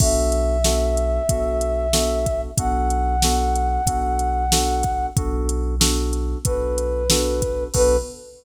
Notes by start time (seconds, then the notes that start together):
0.00 B1 B3 D4 F#4 A4 E5, kick, crash
0.32 closed hi-hat
0.64 B3 D4 F#4 A4, snare
0.97 closed hi-hat
1.29 B1 B3 D4 F#4 A4, kick, closed hi-hat
1.61 closed hi-hat
1.93 B3 D4 F#4 A4, snare
2.26 kick, closed hi-hat
2.58 B1 B3 D4 F#4 A4 F#5, kick, closed hi-hat
2.90 closed hi-hat
3.22 B3 D4 F#4 A4, snare
3.56 closed hi-hat
3.86 B1 B3 D4 F#4 A4, kick, closed hi-hat
4.19 closed hi-hat
4.52 B3 D4 F#4 A4, snare
4.83 kick, closed hi-hat
5.16 B1 B3 D4 F#4 A4, kick, closed hi-hat
5.49 closed hi-hat
5.80 B3 D4 F#4 A4, snare
6.13 closed hi-hat
6.45 B1 B3 D4 F#4 A4 B4, kick, closed hi-hat
6.78 closed hi-hat
7.10 B3 D4 F#4 A4, snare
7.42 kick, closed hi-hat
7.74 B1 B3 D4 F#4 A4 B4, kick, crash